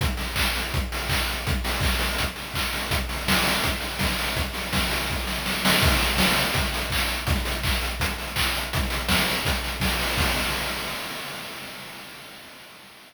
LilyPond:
\new DrumStaff \drummode { \time 4/4 \tempo 4 = 165 <hh bd>8 <hho sn>8 <hc bd>8 hho8 <hh bd>8 hho8 <hc bd>8 hho8 | <hh bd>8 <hho sn>8 <hc bd>8 hho8 <hh bd>8 hho8 <hc bd>8 hho8 | <hh bd>8 <hho sn>8 <bd sn>8 hho8 <hh bd>8 hho8 <bd sn>8 hho8 | <hh bd>8 <hho sn>8 <bd sn>8 hho8 bd8 sn8 sn8 sn8 |
<cymc bd>16 hh16 hho16 hh16 <bd sn>16 hh16 hho16 hh16 <hh bd>16 hh16 hho16 hh16 <hc bd>16 hh16 hho16 hh16 | <hh bd>16 hh16 hho16 hh16 <hc bd>16 hh16 hho16 hh16 <hh bd>16 hh16 hho16 hh16 <hc bd>16 hh16 hho16 hh16 | <hh bd>16 hh16 hho16 hh16 <bd sn>16 hh16 hho16 hh16 <hh bd>16 hh16 hho16 hh16 <bd sn>16 hh16 hho16 hho16 | <cymc bd>4 r4 r4 r4 | }